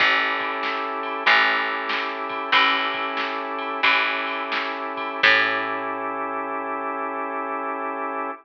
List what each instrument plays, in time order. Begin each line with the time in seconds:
0.00 electric bass (finger) A1, drawbar organ C#4 E4 G4 A4, kick, crash
0.40 kick, ride
0.63 snare
1.03 ride
1.26 electric bass (finger) A1, drawbar organ C#4 E4 G4 A4, kick, ride
1.89 snare, ride
2.29 kick, ride
2.52 electric bass (finger) A1, drawbar organ C#4 E4 G4 A4, kick, ride
2.94 kick, ride
3.17 snare
3.58 ride
3.83 electric bass (finger) A1, drawbar organ C#4 E4 G4 A4, kick, ride
4.27 ride
4.52 snare
4.97 kick, ride
5.23 electric bass (finger) A2, drawbar organ C#4 E4 G4 A4, kick, crash